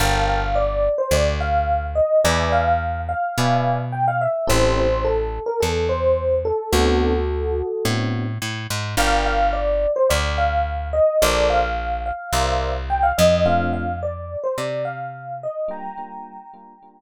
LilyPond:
<<
  \new Staff \with { instrumentName = "Electric Piano 1" } { \time 4/4 \key g \minor \tempo 4 = 107 f''8 f''8 d''8. c''16 d''8 f''4 ees''8 | d''8 f''4 f''4. g''16 f''16 e''8 | c''8 c''8 a'8. bes'16 a'8 c''4 a'8 | <fis' a'>2~ <fis' a'>8 r4. |
f''8 f''8 d''8. c''16 d''8 f''4 ees''8 | d''8 f''4 f''4. g''16 f''16 ees''8 | f''8 f''8 d''8. c''16 d''8 f''4 ees''8 | <g'' bes''>2. r4 | }
  \new Staff \with { instrumentName = "Electric Piano 1" } { \time 4/4 \key g \minor <bes' f'' g'' a''>1 | <b' d'' e'' gis''>2 <b' d'' e'' gis''>2 | <c' e' g' a'>1 | <b c' d' fis'>2 <b c' d' fis'>2 |
<bes' d'' f'' g''>1 | <a' bes' c'' d''>2 <bes' c'' d'' e''>2 | <a c' d' f'>1 | <g bes d' f'>8 <g bes d' f'>4 <g bes d' f'>8 <g bes d' f'>2 | }
  \new Staff \with { instrumentName = "Electric Bass (finger)" } { \clef bass \time 4/4 \key g \minor g,,2 d,2 | e,2 b,2 | a,,2 e,2 | d,2 a,4 a,8 gis,8 |
g,,2 d,2 | bes,,2 c,4. f,8~ | f,2 c2 | r1 | }
>>